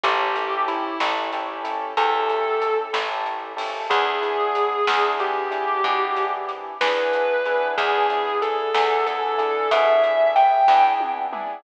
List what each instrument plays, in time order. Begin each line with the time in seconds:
0.03 electric bass (finger) A1, acoustic grand piano C#4 E4 G4 A4, distortion guitar G4, kick, closed hi-hat
0.35 acoustic grand piano C#4 E4 G4 A4, closed hi-hat
0.68 distortion guitar E4, closed hi-hat
1.00 electric bass (finger) A1, acoustic grand piano C#4 E4 G4 A4, snare
1.33 acoustic grand piano C#4 E4 G4 A4, closed hi-hat
1.64 acoustic grand piano C#4 E4 G4 A4, closed hi-hat
1.97 electric bass (finger) E2, acoustic grand piano C#4 E4 G4 A4, distortion guitar A4, kick, closed hi-hat
2.29 closed hi-hat
2.62 closed hi-hat
2.93 electric bass (finger) A1, acoustic grand piano C#4 E4 G4 A4, snare
3.26 closed hi-hat
3.57 acoustic grand piano C#4 E4 G4 A4, open hi-hat
3.90 electric bass (finger) E2, acoustic grand piano B3 D4 E4 G#4, distortion guitar G#4, kick, closed hi-hat
4.21 acoustic grand piano B3 D4 E4 G#4, closed hi-hat
4.55 closed hi-hat
4.87 electric bass (finger) E2, acoustic grand piano B3 D4 E4 G#4, snare
5.19 acoustic grand piano B3 D4 E4 G#4, distortion guitar G4, closed hi-hat
5.51 acoustic grand piano B3 D4 E4 G#4, closed hi-hat
5.84 electric bass (finger) B2, acoustic grand piano B3 D4 E4 G#4, kick, closed hi-hat
6.16 closed hi-hat
6.49 closed hi-hat
6.81 electric bass (finger) E2, acoustic grand piano B3 D4 E4 G#4, distortion guitar B4, snare
7.13 closed hi-hat
7.45 acoustic grand piano B3 D4 E4 G#4, closed hi-hat
7.77 electric bass (finger) E2, acoustic grand piano B3 D4 E4 G#4, distortion guitar G#4, kick, closed hi-hat
8.10 acoustic grand piano B3 D4 E4 G#4, closed hi-hat
8.42 distortion guitar A4, closed hi-hat
8.74 electric bass (finger) E2, acoustic grand piano B3 D4 E4 G#4, snare
9.06 acoustic grand piano B3 D4 E4 G#4, distortion guitar A4, closed hi-hat
9.38 acoustic grand piano B3 D4 E4 G#4, closed hi-hat
9.71 electric bass (finger) B2, acoustic grand piano B3 D4 E4 G#4, distortion guitar E5, kick, closed hi-hat
10.03 closed hi-hat
10.36 distortion guitar G5, closed hi-hat
10.68 electric bass (finger) E2, acoustic grand piano B3 D4 E4 G#4, kick, snare
11.00 high tom
11.33 acoustic grand piano B3 D4 E4 G#4, mid tom